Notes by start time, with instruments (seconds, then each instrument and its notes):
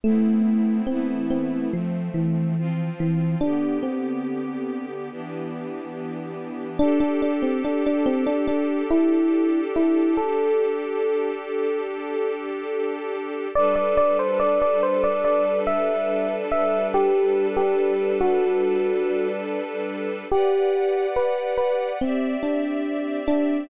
0.04 string ensemble 1 A3 B3 C4 E4, electric piano 1 A3
0.87 string ensemble 1 E3 A3 B3 E4, electric piano 1 C4
1.30 electric piano 1 C4
1.72 string ensemble 1 F3 A3 C4, electric piano 1 F3
2.14 electric piano 1 E3
2.57 string ensemble 1 F3 C4 F4
3.00 electric piano 1 E3
3.41 string ensemble 1 D3 B3 G4, electric piano 1 D4
3.83 electric piano 1 C4
5.11 string ensemble 1 E3 B3 D4 G4
6.79 electric piano 1 D4, string ensemble 1 D4 G4 A4
7.00 electric piano 1 D4
7.22 electric piano 1 D4
7.42 electric piano 1 C4
7.65 electric piano 1 D4
7.86 electric piano 1 D4
8.06 electric piano 1 C4
8.27 electric piano 1 D4
8.48 electric piano 1 D4
8.90 electric piano 1 E4
9.76 electric piano 1 E4
10.17 electric piano 1 A4
13.55 string ensemble 1 G3 D4 A4 B4, electric piano 1 D5
13.76 electric piano 1 D5
13.97 electric piano 1 D5
14.19 electric piano 1 C5
14.40 electric piano 1 D5
14.62 electric piano 1 D5
14.83 electric piano 1 C5
15.04 electric piano 1 D5
15.24 electric piano 1 D5
15.67 electric piano 1 E5
16.52 electric piano 1 E5
16.94 electric piano 1 G4
17.57 electric piano 1 G4
18.21 electric piano 1 F#4
20.31 string ensemble 1 G4 B4 D5 F#5, electric piano 1 G4
21.16 electric piano 1 B4
21.58 electric piano 1 B4
22.01 electric piano 1 C4, string ensemble 1 C4 G4 D5 E5
22.43 electric piano 1 D4
23.28 electric piano 1 D4